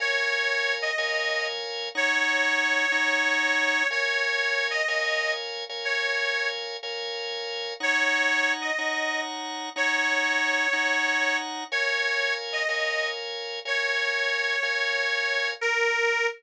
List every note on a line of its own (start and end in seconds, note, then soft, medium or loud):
0.00 0.91 A#4 medium
0.00 0.91 C#5 medium
0.00 0.74 C#5 loud
0.00 0.91 F5 medium
0.00 0.91 G#5 medium
0.82 1.46 D#5 medium
0.98 1.89 A#4 medium
0.98 1.89 C#5 medium
0.98 1.89 F5 medium
0.98 1.89 G#5 medium
1.95 2.86 D#4 medium
1.95 2.86 C#5 medium
1.95 3.87 C#5 loud
1.95 2.86 F#5 medium
1.95 2.86 A#5 medium
2.92 3.83 D#4 medium
2.92 3.83 C#5 medium
2.92 3.83 F#5 medium
2.92 3.83 A#5 medium
3.91 4.82 A#4 medium
3.91 4.82 C#5 medium
3.91 4.67 C#5 loud
3.91 4.82 F5 medium
3.91 4.82 G#5 medium
4.70 5.32 D#5 medium
4.88 5.64 A#4 medium
4.88 5.64 C#5 medium
4.88 5.64 F5 medium
4.88 5.64 G#5 medium
5.69 6.77 A#4 medium
5.69 6.77 C#5 medium
5.69 6.77 F5 medium
5.69 6.77 G#5 medium
5.85 6.48 C#5 medium
6.83 7.74 A#4 loud
6.83 7.74 C#5 medium
6.83 7.74 F5 medium
6.83 7.74 G#5 medium
7.80 8.71 D#4 medium
7.80 8.71 C#5 medium
7.80 8.52 C#5 loud
7.80 8.71 F#5 medium
7.80 8.71 A#5 medium
8.61 9.20 D#5 medium
8.78 9.69 D#4 medium
8.78 9.69 C#5 medium
8.78 9.69 F#5 medium
8.78 9.69 A#5 medium
9.76 10.67 D#4 medium
9.76 10.67 C#5 medium
9.76 11.37 C#5 loud
9.76 10.67 F#5 medium
9.76 10.67 A#5 medium
10.73 11.64 D#4 medium
10.73 11.64 C#5 medium
10.73 11.64 F#5 medium
10.73 11.64 A#5 medium
11.72 12.63 A#4 medium
11.72 12.34 C#5 loud
11.72 12.63 C#5 medium
11.72 12.63 F5 medium
11.72 12.63 G#5 medium
12.52 13.08 D#5 medium
12.69 13.60 A#4 medium
12.69 13.60 C#5 medium
12.69 13.60 F5 medium
12.69 13.60 G#5 medium
13.65 14.56 A#4 medium
13.65 14.56 C#5 medium
13.65 15.49 C#5 medium
13.65 14.56 F5 medium
13.65 14.56 G#5 medium
14.63 15.54 A#4 medium
14.63 15.54 C#5 medium
14.63 15.54 F5 medium
14.63 15.54 G#5 medium
15.61 16.26 A#4 loud